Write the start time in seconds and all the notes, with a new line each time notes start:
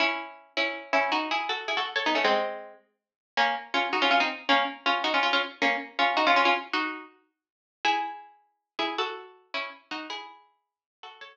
0.00 C#4 E4
0.57 C#4 E4
0.93 C#4 E4
1.12 D#4 F#4
1.31 E4 G#4
1.49 F#4 A4
1.68 E4 G#4
1.77 F#4 A4
1.96 A4 C#5
2.06 B3 D#4
2.15 A3 C#4
2.24 G#3 C4
3.37 A#3 C#4
3.74 C#4 F4
3.93 D#4 F#4
4.02 C#4 F4
4.11 C#4 F4
4.20 C4 D#4
4.49 A#3 C#4
4.86 C#4 F4
5.04 D#4 F#4
5.14 C#4 F4
5.23 C#4 F4
5.33 C#4 F4
5.62 A#3 C#4
5.99 C#4 F4
6.17 D#4 F#4
6.27 C#4 F4
6.36 C#4 F4
6.45 C#4 F4
6.73 D#4 F#4
7.85 E4 G#4
8.79 E4 G#4
8.98 F#4 A4
9.54 C#4 E4
9.91 D#4 F#4
10.10 E4 G#4
11.03 F#4 A4
11.21 A4 C#5